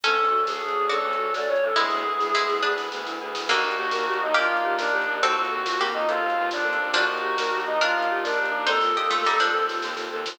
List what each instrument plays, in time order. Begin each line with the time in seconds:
0.03 violin D2, brass section C#4 D4 F#4 A4, harpsichord C#4 A4, marimba C#4, choir aahs A4, kick, closed hi-hat
0.19 violin D2, marimba D4
0.24 closed hi-hat
0.31 violin D2, marimba F#4
0.47 violin D2, choir aahs G#4, marimba A4, snare
0.61 violin D2, marimba F#4
0.68 closed hi-hat
0.75 violin D2, marimba D4
0.89 violin D2, brass section C#4 D4 A4 C#5, marimba C#4, harpsichord F#4 D5, choir aahs A4, closed hi-hat
1.03 violin D2, marimba D4
1.13 closed hi-hat
1.18 violin D2, marimba F#4
1.33 violin D2, marimba A4, choir aahs D5, snare
1.48 violin D2, marimba F#4, choir aahs C#5
1.56 closed hi-hat
1.61 violin D2, marimba D4, choir aahs A4
1.76 violin D2, harpsichord G#3 E4, brass section B3 E4 G#4, marimba B3, choir aahs G#4, kick, snare
1.90 violin D2, marimba E4, snare
2.04 violin D2, marimba G#4
2.19 violin D2, marimba E4, snare
2.34 violin D2, harpsichord G#3 E4, marimba B3, snare
2.49 violin D2, marimba E4, snare
2.62 violin D2, brass section B3 G#4 B4, harpsichord D4 B4, marimba G#4
2.76 violin D2, marimba E4, snare
2.92 violin D2, marimba B3, snare
3.05 violin D2, marimba E4, snare
3.21 violin D2, marimba G#4
3.34 violin D2, marimba E4, snare
3.48 violin D#2, harpsichord D3 A#3, brass section D4 D#4 G4 A#4, marimba D4, choir aahs F#4, kick, crash
3.63 violin D#2, marimba D#4
3.71 closed hi-hat
3.77 violin D#2, marimba G4
3.91 violin D#2, marimba A#4, snare
4.07 violin D#2, marimba G4
4.13 closed hi-hat
4.20 violin D#2, marimba D#4, choir aahs D#4
4.34 violin D#2, harpsichord A#3 G4, marimba D4, brass section D4 D#4 A#4 D5, choir aahs F4, closed hi-hat
4.49 violin D#2, marimba D#4
4.57 closed hi-hat
4.63 violin D#2, marimba G4
4.78 violin D#2, choir aahs D4, marimba A#4, snare
4.93 violin D#2, marimba G4
5.01 closed hi-hat
5.07 violin D#2, marimba D#4
5.21 violin D#2, brass section C4 F4 A4, marimba C4, harpsichord C4 A4, choir aahs F#4, kick, closed hi-hat
5.35 violin D#2, marimba F4
5.45 closed hi-hat
5.50 violin D#2, marimba A4
5.65 violin D#2, marimba F4, snare
5.78 violin D#2, harpsichord A#3 G4, marimba C4
5.86 closed hi-hat
5.93 violin D#2, choir aahs D#4, marimba F4
6.07 violin D#2, brass section C4 A4 C5, choir aahs F4, marimba A4, closed hi-hat
6.22 violin D#2, marimba F4
6.30 closed hi-hat
6.37 violin D#2, marimba C4
6.51 violin D#2, choir aahs D4, marimba F4, snare
6.64 violin D#2, marimba A4
6.73 closed hi-hat
6.79 violin D#2, marimba F4
6.93 violin D#2, harpsichord F3 D4, brass section D4 D#4 G4 A#4, marimba D4, choir aahs F#4, kick, closed hi-hat
7.09 violin D#2, marimba D#4
7.17 closed hi-hat
7.22 violin D#2, marimba G4
7.37 violin D#2, marimba A#4, snare
7.53 violin D#2, marimba G4
7.60 closed hi-hat
7.65 violin D#2, marimba D#4, choir aahs D#4
7.81 violin D#2, marimba D4, harpsichord D4 A#4, brass section D4 D#4 A#4 D5, choir aahs F4, closed hi-hat
7.95 violin D#2, marimba D#4
8.02 closed hi-hat
8.10 violin D#2, marimba G4
8.24 violin D#2, choir aahs D4, marimba A#4, snare
8.37 violin D#2, marimba G4
8.45 closed hi-hat
8.51 violin D#2, marimba D#4
8.66 violin D#2, marimba C4, brass section C4 F4 A4, harpsichord D#4 C5, choir aahs A4, kick, snare
8.81 violin D#2, marimba F4, snare
8.97 violin D#2, harpsichord G4 D#5, marimba A4
9.10 violin D#2, harpsichord A3 F4, marimba F4, snare
9.24 violin D#2, harpsichord G3 D#4, marimba C4, snare
9.38 violin D#2, harpsichord F3 D4, marimba F4, snare
9.53 violin D#2, brass section C4 A4 C5, marimba A4
9.68 violin D#2, marimba F4, snare
9.82 violin D#2, marimba C4, snare
9.96 violin D#2, marimba F4, snare
10.12 violin D#2, marimba A4
10.25 violin D#2, marimba F4, snare